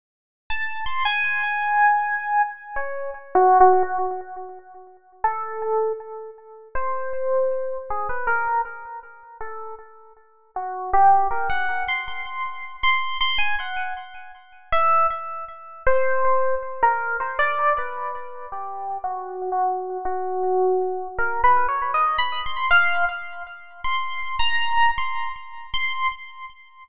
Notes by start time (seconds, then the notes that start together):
0.50 A5
0.86 C6
1.05 G#5
2.76 C#5
3.35 F#4
3.60 F#4
3.83 F#4
5.24 A4
6.75 C5
7.90 G#4
8.09 B4
8.27 A#4
9.41 A4
10.56 F#4
10.93 G4
11.31 A#4
11.50 F#5
11.88 C6
12.08 C6
12.83 C6
13.21 C6
13.38 G#5
13.60 F#5
14.72 E5
15.87 C5
16.83 A#4
17.20 C5
17.39 D5
17.78 B4
18.52 G4
19.04 F#4
19.52 F#4
20.05 F#4
21.19 A#4
21.44 B4
21.69 C#5
21.94 D#5
22.18 B5
22.46 C6
22.71 F5
23.84 C6
24.39 A#5
24.98 C6
25.74 C6